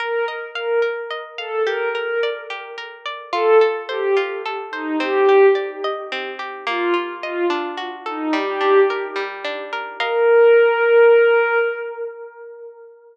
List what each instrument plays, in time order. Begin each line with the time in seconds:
0.00 orchestral harp A#4, pad 5 (bowed) A#4
0.28 orchestral harp D#5
0.55 pad 5 (bowed) A#4, orchestral harp F5
0.82 orchestral harp A#4
1.11 orchestral harp D#5
1.38 pad 5 (bowed) A4, orchestral harp F5
1.66 orchestral harp G4, pad 5 (bowed) A#4
1.95 pad 5 (bowed) A#4, orchestral harp A#4
2.23 orchestral harp D5
2.50 orchestral harp G4
2.78 orchestral harp A#4
3.06 orchestral harp D5
3.32 orchestral harp F4, pad 5 (bowed) A4
3.61 orchestral harp A4
3.89 pad 5 (bowed) G4, orchestral harp C5
4.17 orchestral harp F4
4.46 orchestral harp A4
4.71 pad 5 (bowed) D#4, orchestral harp C5
5.00 orchestral harp C4, pad 5 (bowed) G4
5.29 orchestral harp G4
5.55 orchestral harp D5
5.84 orchestral harp D#5
6.12 orchestral harp C4
6.39 orchestral harp G4
6.67 orchestral harp A#3, pad 5 (bowed) F4
6.94 orchestral harp F4
7.22 pad 5 (bowed) F4, orchestral harp D#5
7.50 orchestral harp D4
7.77 orchestral harp F#4
8.06 pad 5 (bowed) D#4, orchestral harp A4
8.33 orchestral harp G3, pad 5 (bowed) G4
8.61 orchestral harp D4
8.90 orchestral harp A#4
9.16 orchestral harp G3
9.45 orchestral harp D4
9.73 orchestral harp A#4
9.99 pad 5 (bowed) A#4, orchestral harp A#4 D#5 F5